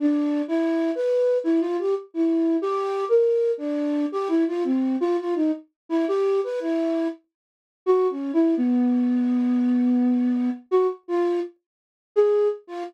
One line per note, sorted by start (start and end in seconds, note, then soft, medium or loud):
0.00 0.42 D4 medium
0.48 0.91 E4 medium
0.95 1.38 B4 medium
1.44 1.60 E4 loud
1.61 1.77 F4 loud
1.78 1.94 G4 medium
2.14 2.57 E4 medium
2.62 3.05 G4 loud
3.09 3.51 A#4 medium
3.58 4.06 D4 medium
4.12 4.28 G4 medium
4.28 4.44 E4 medium
4.47 4.63 F4 medium
4.64 4.96 C4 medium
5.01 5.17 F4 loud
5.18 5.34 F4 medium
5.35 5.51 D#4 medium
5.89 6.05 E4 loud
6.08 6.40 G4 loud
6.44 6.60 B4 medium
6.60 7.08 E4 medium
7.86 8.07 F#4 medium
8.10 8.32 C#4 medium
8.33 8.55 E4 medium
8.57 10.50 B3 loud
10.71 10.87 F#4 loud
11.08 11.40 F4 medium
12.16 12.48 G#4 loud
12.67 12.83 F4 medium